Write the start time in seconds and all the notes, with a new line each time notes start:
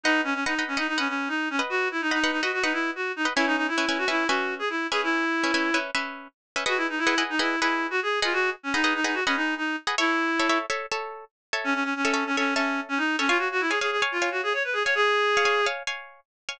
0.03 D#4 B4 D#5 F#5
0.24 C#4
0.34 C#4
0.46 D#4 B4 D#5 F#5
0.59 B4 D#5 F#5
0.68 C#4
0.77 D#4 B4 D#5 F#5
0.88 D#4
0.98 C#4 B4 D#5 F#5
1.08 C#4
1.28 D#4
1.50 C#4
1.59 B4 D#5 F#5
1.69 F#4
1.91 E4
2.01 D#4
2.11 D#4 B4 D#5 F#5
2.24 B4 D#5 F#5
2.31 D#4
2.42 F#4 B4 D#5 F#5
2.53 F#4
2.63 D#4 B4 D#5 F#5
2.73 E4
2.95 F#4
3.16 D#4
3.25 B4 D#5 F#5
3.36 C#4 E4 B4 E5 G#5
3.46 D#4
3.57 D#4
3.68 E4
3.78 C#4 B4 E5 G#5
3.89 C#4 B4 E5 G#5
3.98 F#4
4.08 C#4 E4 B4 E5 G#5
4.27 C#4 F#4 B4 E5 G#5
4.59 G#4
4.70 E4
4.91 C#4 G#4 B4 E5 G#5
5.03 E4
5.44 C#4 B4 E5 G#5
5.54 C#4 B4 E5 G#5
5.74 C#4 B4 E5 G#5
5.95 C#4 B4 E5 G#5
6.56 C#4 B4 E5 G#5
6.66 F#4 G#4 B4 D#5 F#5
6.77 E4
6.89 D#4
6.98 E4
7.07 G#4 B4 D#5 F#5
7.18 G#4 B4 D#5 F#5
7.30 D#4
7.39 E4 G#4 B4 D#5 F#5
7.60 E4 G#4 B4 D#5 F#5
7.90 F#4
8.02 G#4
8.22 F4 G#4 B4 D#5 F#5
8.33 F#4
8.63 C#4
8.74 D#4 G#4 B4 D#5 F#5
8.84 G#4 B4 D#5 F#5
8.95 D#4
9.04 D#4 G#4 B4 D#5 F#5
9.14 F#4
9.26 C#4 G#4 B4 D#5 F#5
9.36 D#4
9.57 D#4
9.87 G#4 B4 D#5 F#5
9.98 E4 A4 C#5 E5
10.39 A4 C#5 E5
10.49 A4 C#5 E5
10.70 A4 C#5 E5
10.91 A4 C#5 E5
11.53 A4 C#5 E5
11.64 C#4
11.74 C#4
11.84 C#4
11.96 C#4
12.05 A4 C#5 E5
12.14 A4 C#5 E5
12.26 C#4
12.37 C#4 A4 C#5 E5
12.55 C#4 A4 C#5 E5
12.89 C#4
12.97 D#4
13.19 C#4 A4 C#5 E5
13.28 F4 C#5 F5 G#5
13.38 F#4
13.52 F#4
13.61 E4
13.70 G#4 C#5 F5 G#5
13.81 G#4 C#5 F5 G#5
13.91 G#4
14.02 C#5 F5 G#5
14.12 F4
14.22 C#5 F5 G#5
14.31 F#4
14.43 G#4
14.53 C#5
14.64 B4
14.73 G#4
14.84 C#5 F5 G#5
14.95 G#4
15.37 C#5 F5 G#5
15.45 C#5 F5 G#5
15.66 C#5 F5 G#5
15.87 C#5 F5 G#5
16.49 C#5 F5 G#5